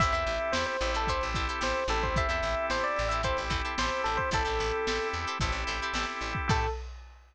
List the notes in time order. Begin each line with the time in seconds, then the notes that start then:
0.00 A1 C4 E4 G4 A4 C5 E5, kick, closed hi-hat
0.12 E2 E4 G4 A4 C5 E5, closed hi-hat
0.27 A1, snare, closed hi-hat
0.40 closed hi-hat
0.52 E2 E4 G4 A4 C5, snare
0.56 C5
0.66 C5, closed hi-hat
0.81 A1 C4 E4 G4 A4, closed hi-hat
0.94 E4 G4 A4 C5, closed hi-hat
1.07 E4 G4 A4 C5, kick, closed hi-hat
1.21 A1, closed hi-hat
1.34 A1 E4 G4 A4 C5, kick, closed hi-hat
1.48 E4 G4 A4 C5, closed hi-hat
1.61 A1 E4 G4 A4 C5, snare
1.76 snare, closed hi-hat
1.88 A1 C4 E4 G4 A4, snare, closed hi-hat
2.02 C5, kick, closed hi-hat
2.16 E4 G4 A4 C5 E5, kick, closed hi-hat
2.29 E2 E4 G4 A4 C5 E5, snare, closed hi-hat
2.42 A1, snare, closed hi-hat
2.57 closed hi-hat
2.70 A1 E4 G4 A4 C5, snare
2.83 D5, closed hi-hat
2.96 A1, closed hi-hat
3.09 E4 G4 A4 C5 E5, closed hi-hat
3.23 C4 E4 G4 A4 C5, kick, closed hi-hat
3.37 A1, closed hi-hat
3.50 A1 E4 G4 A4 C5, kick, closed hi-hat
3.65 E4 G4 A4 C5, closed hi-hat
3.78 A1 E4 G4 A4 C5, snare
3.92 closed hi-hat
4.04 A1 A4, snare, closed hi-hat
4.17 C5, kick, snare, closed hi-hat
4.31 A1 C4 E4 G4 A4 C5, kick, closed hi-hat
4.45 A1 E4 G4 A4 C5, closed hi-hat
4.59 A1, snare, closed hi-hat
4.73 closed hi-hat
4.87 A1 E4 G4 A4 C5, snare
5.00 closed hi-hat
5.13 E2, closed hi-hat
5.27 E4 G4 A4 C5, closed hi-hat
5.40 A1 C4 E4 G4 A4 C5, kick, closed hi-hat
5.52 A1, closed hi-hat
5.67 A1 E4 G4 A4 C5, closed hi-hat
5.82 E4 G4 A4 C5, closed hi-hat
5.93 A1 E4 G4 A4 C5, snare
6.08 snare, closed hi-hat
6.21 A1, closed hi-hat
6.35 kick, closed hi-hat
6.48 A2 C4 E4 G4 A4 C5, kick, crash